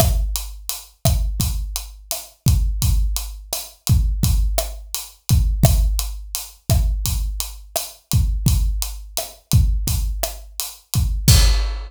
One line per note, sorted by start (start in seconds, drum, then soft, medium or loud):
0.00 kick medium
0.00 cross-stick loud
0.00 closed hi-hat medium
0.36 closed hi-hat medium
0.69 closed hi-hat medium
1.05 kick medium
1.05 cross-stick medium
1.05 closed hi-hat medium
1.40 kick medium
1.40 closed hi-hat loud
1.76 closed hi-hat medium
2.11 cross-stick medium
2.11 closed hi-hat loud
2.46 kick medium
2.46 closed hi-hat medium
2.82 kick medium
2.82 closed hi-hat loud
3.16 closed hi-hat medium
3.53 cross-stick medium
3.53 closed hi-hat loud
3.87 kick medium
3.87 closed hi-hat medium
4.23 kick medium
4.23 closed hi-hat medium
4.58 cross-stick medium
4.58 closed hi-hat medium
4.95 closed hi-hat loud
5.29 kick medium
5.29 closed hi-hat medium
5.63 kick loud
5.63 cross-stick loud
5.63 closed hi-hat loud
5.99 closed hi-hat medium
6.35 closed hi-hat loud
6.70 kick medium
6.70 cross-stick medium
6.70 closed hi-hat medium
7.05 kick medium
7.05 closed hi-hat loud
7.40 closed hi-hat medium
7.76 cross-stick medium
7.76 closed hi-hat loud
8.11 kick medium
8.11 closed hi-hat medium
8.46 kick medium
8.46 closed hi-hat medium
8.82 closed hi-hat medium
9.17 cross-stick medium
9.17 closed hi-hat medium
9.51 kick medium
9.51 closed hi-hat medium
9.87 kick medium
9.87 closed hi-hat loud
10.23 cross-stick medium
10.23 closed hi-hat medium
10.60 closed hi-hat loud
10.94 kick medium
10.94 closed hi-hat medium
11.28 kick loud
11.28 crash loud